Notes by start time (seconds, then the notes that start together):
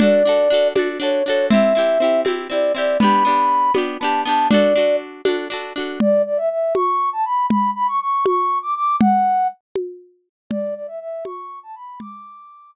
0.00 D4 F#4 A4 D5, low conga
0.25 D4 F#4 A4
0.50 D4 F#4 A4
0.75 D4 F#4 A4, high conga
1.00 D4 F#4 A4 C#5
1.25 D4 F#4 C#5
1.30 A4
1.50 C4 E4 E5, low conga
1.54 G4
1.75 C4 E4 G4
2.00 C4 E4 G4
2.25 C4 E4 G4, high conga
2.50 C4 E4 G4 D5
2.75 C4 E4 G4 D5
3.00 B3 D4 B5, low conga
3.04 G4
3.25 B3 D4 G4
3.74 B3 D4 G4, high conga
4.00 B3 D4 A5
4.04 G4
4.25 B3 D4 A5
4.29 G4
4.49 D4 F#4 D5, low conga
4.54 A4
4.76 D4 F#4 A4
5.25 D4 F#4 A4, high conga
5.50 D4 F#4 A4
5.76 D4 F#4 A4
6.00 D5, low conga
6.26 D5
6.37 E5
6.50 E5
6.74 C#6, high conga
7.13 A5
7.25 B5
7.50 B5, low conga
7.75 B5
7.88 C#6
8.00 C#6
8.26 C#6, high conga
8.62 D6
8.75 D6
9.00 F#5, low conga
9.76 high conga
10.50 D5, low conga
10.75 D5
10.87 E5
11.00 E5
11.25 C#6, high conga
11.63 A5
11.75 B5
12.00 D6, low conga